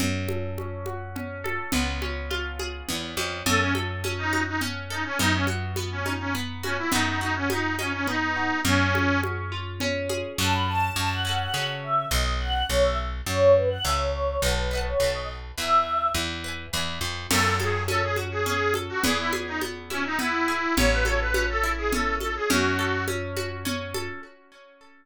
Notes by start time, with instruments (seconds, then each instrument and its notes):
0.00 electric bass (finger) F#2, orchestral harp C#4, low conga
0.29 orchestral harp A4, high conga
0.58 orchestral harp C#4, high conga
0.86 orchestral harp F#4, high conga
1.16 orchestral harp C#4, low conga
1.44 orchestral harp A4, high conga
1.72 electric bass (finger) C#2, orchestral harp B3, low conga
2.02 orchestral harp C#4, high conga
2.31 orchestral harp F4, high conga
2.59 orchestral harp G#4, high conga
2.89 electric bass (finger) E2, orchestral harp B3, low conga
3.17 electric bass (finger) F2, orchestral harp C#4, high conga
3.46 electric bass (finger) F#2, orchestral harp C#4, accordion A4, low conga
3.61 accordion C#4
3.75 orchestral harp A4, high conga
4.04 orchestral harp C#4, high conga
4.18 accordion D#4
4.33 orchestral harp F#4, high conga
4.47 accordion D#4
4.61 orchestral harp C#4, low conga
4.90 accordion D#4, orchestral harp A4
5.05 accordion C#4
5.19 electric bass (finger) F#2, orchestral harp B3, accordion D#4, low conga
5.34 accordion C#4
5.47 orchestral harp F#4, high conga
5.76 orchestral harp B3, high conga
5.91 accordion C#4
6.06 orchestral harp D#4, high conga
6.20 accordion C#4
6.35 orchestral harp B3, low conga
6.63 accordion C#4, orchestral harp F#4, high conga
6.78 accordion E4
6.92 electric bass (finger) F#2, orchestral harp B3, accordion D#4, low conga
7.07 accordion D#4
7.21 accordion D#4, orchestral harp F#4
7.36 accordion C#4
7.50 orchestral harp B3, accordion D#4, high conga
7.79 accordion C#4, orchestral harp D#4, high conga
7.93 accordion C#4
8.07 orchestral harp B3, accordion D#4, low conga
8.36 orchestral harp F#4
8.65 electric bass (finger) F#2, accordion C#4, orchestral harp C#4, low conga
8.94 orchestral harp G#4, high conga
9.23 orchestral harp C#4, high conga
9.52 orchestral harp F4
9.80 orchestral harp C#4, low conga
10.09 orchestral harp G#4, high conga
10.38 electric bass (finger) F#2, orchestral harp C#4 F#4, choir aahs A5
10.43 orchestral harp A4
10.53 choir aahs B5
10.67 choir aahs A5
10.96 electric bass (finger) F#2, choir aahs A5
11.11 choir aahs F#5
11.25 orchestral harp C#4 F#4
11.29 orchestral harp A4
11.39 choir aahs F#5
11.54 electric bass (finger) C#3, orchestral harp C#4 F#4, choir aahs F#5
11.58 orchestral harp A4
11.83 choir aahs E5
12.11 electric bass (finger) B1, choir aahs D#5
12.40 choir aahs F#5
12.69 electric bass (finger) B1, choir aahs C#5
12.84 choir aahs E5
13.26 electric bass (finger) F#2, choir aahs C#5
13.56 choir aahs B4
13.70 choir aahs F#5
13.84 electric bass (finger) C#2, orchestral harp C#5 E5, choir aahs E5
13.89 orchestral harp G#5
13.99 choir aahs C#5
14.42 electric bass (finger) B1, choir aahs B4, orchestral harp B4 D#5
14.47 orchestral harp F#5 A5
14.71 orchestral harp B4 D#5
14.75 orchestral harp F#5 A5
14.86 choir aahs C#5
15.00 electric bass (finger) B1, orchestral harp B4 D#5, choir aahs C#5
15.04 orchestral harp F#5 A5
15.14 choir aahs D#5
15.58 electric bass (finger) E2, orchestral harp B4 E5, choir aahs E5
15.62 orchestral harp G#5
16.14 electric bass (finger) E2
16.44 orchestral harp B4 E5
16.48 orchestral harp G#5
16.73 electric bass (finger) E2, orchestral harp B4 E5
16.77 orchestral harp G#5
17.01 electric bass (finger) F2
17.31 electric bass (finger) F#2, orchestral harp C#4, accordion A4, crash, low conga
17.59 accordion G#4, orchestral harp A4, high conga
17.88 orchestral harp C#4, accordion A4, high conga
18.03 accordion G#4
18.16 orchestral harp F#4, high conga
18.32 accordion G#4
18.46 orchestral harp C#4, accordion G#4, low conga
18.74 orchestral harp A4, high conga
18.89 accordion F#4
19.04 electric bass (finger) E2, orchestral harp B3, accordion G#4, low conga
19.18 accordion E4
19.33 orchestral harp G#4, high conga
19.47 accordion D#4
19.61 orchestral harp B3, high conga
19.90 accordion C#4, orchestral harp E4, high conga
20.05 accordion D#4
20.19 orchestral harp B3, accordion E4, low conga
20.48 orchestral harp G#4
20.77 electric bass (finger) A1, orchestral harp C#4, accordion C#5, low conga
20.91 accordion B4
21.05 orchestral harp A4, accordion C#5, high conga
21.20 accordion B4
21.34 orchestral harp C#4, high conga
21.49 accordion A4
21.63 orchestral harp E4
21.78 accordion G#4
21.92 orchestral harp C#4, accordion A4, low conga
22.20 orchestral harp A4, accordion A4, high conga
22.36 accordion G#4
22.50 electric bass (finger) F#2, orchestral harp C#4, accordion F#4, low conga
22.79 orchestral harp A4
23.08 orchestral harp C#4, high conga
23.37 orchestral harp F#4, high conga
23.65 orchestral harp C#4, low conga
23.94 orchestral harp A4, high conga